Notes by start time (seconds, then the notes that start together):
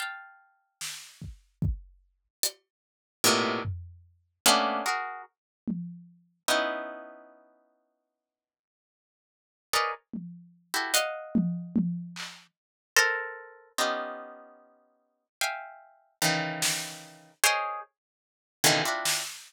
0.00 F5 G5 A5
0.81 snare
1.22 kick
1.62 kick
2.43 closed hi-hat
3.24 A2 A#2 B2 C3
3.65 floor tom
4.46 A3 A#3 B3 C#4 D4
4.86 F#4 G#4 A#4
5.68 high tom
6.48 B3 C#4 D#4 E4, cowbell
9.73 G#4 A#4 B4 C#5 D5 D#5
10.14 high tom
10.74 E4 F#4 G4 A4
10.94 D#5 F5 F#5, closed hi-hat
11.35 high tom
11.76 high tom
12.16 clap
12.96 A4 A#4 C5
13.78 B3 C#4 D#4 F4 G4
15.41 E5 F5 G5 G#5
16.22 C#3 D#3 E3
16.62 snare
17.44 G#4 A#4 C5 C#5 D#5
18.64 B2 C#3 D3 D#3 E3
18.85 C4 D4 E4 F4 F#4
19.05 snare